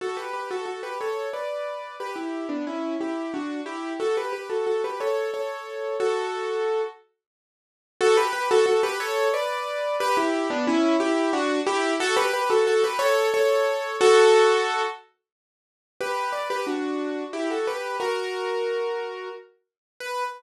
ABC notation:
X:1
M:3/4
L:1/16
Q:1/4=90
K:D
V:1 name="Acoustic Grand Piano"
[FA] [GB] [GB] [FA] [FA] [GB] [Ac]2 [Bd]4 | [GB] [EG]2 [B,D] [CE]2 [EG]2 [DF]2 [EG]2 | [FA] [GB] [GB] [FA] [FA] [GB] [Ac]2 [Ac]4 | [FA]6 z6 |
[FA] [GB] [GB] [FA] [FA] [GB] [Ac]2 [Bd]4 | [GB] [EG]2 [B,D] [CE]2 [EG]2 [DF]2 [EG]2 | [FA] [GB] [GB] [FA] [FA] [GB] [Ac]2 [Ac]4 | [FA]6 z6 |
[K:Bm] [GB]2 [Bd] [GB] [DF]4 [EG] [FA] [GB]2 | [F^A]8 z4 | B4 z8 |]